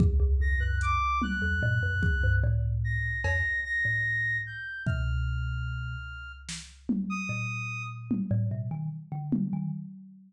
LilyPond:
<<
  \new Staff \with { instrumentName = "Kalimba" } { \clef bass \time 6/4 \tempo 4 = 74 dis,16 dis,16 e,16 fis,8 r8 e,16 ais,16 fis,16 dis,16 g,16 a,8. r16 f,16 r8 a,8. r8 | b,4. r4. ais,4~ ais,16 a,16 b,16 dis16 r16 d8 dis16 | }
  \new Staff \with { instrumentName = "Clarinet" } { \time 6/4 r8 ais'''16 fis'''16 d'''8 fis'''4. r8 ais'''8 ais'''8 ais'''4 g'''8 | f'''2 r8. dis'''4 r2 r16 | }
  \new DrumStaff \with { instrumentName = "Drums" } \drummode { \time 6/4 bd4 hh8 tommh8 tomfh8 bd8 r4 cb4 r4 | bd4 r4 sn8 tommh8 r4 tommh4 r8 tommh8 | }
>>